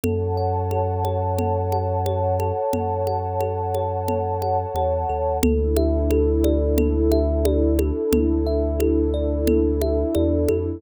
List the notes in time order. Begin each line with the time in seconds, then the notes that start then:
0.04 F#2 A4 C#5 F#5 A5, low conga
0.37 F#5
0.71 A4, high conga
1.05 C#5, high conga
1.38 A4, low conga
1.72 F#5, high conga
2.06 C#5, high conga
2.40 A4, high conga
2.73 F#2 A4, low conga
3.07 F#5, high conga
3.40 A4, high conga
3.75 C#5, high conga
4.08 A4, low conga
4.42 F#5, high conga
4.74 E2 C#5, high conga
5.09 D#2 A4
5.43 D2 D4 E4 A4, low conga
5.77 E5, high conga
6.10 A4, high conga
6.44 D5, high conga
6.78 A4, low conga
7.12 E5, high conga
7.45 D5, high conga
7.79 A4, high conga
8.12 D2 A4, low conga
8.46 E5
8.80 A4, high conga
9.14 D5
9.47 A4, low conga
9.81 E5, high conga
10.15 E2 D5, high conga
10.48 F2 A4, high conga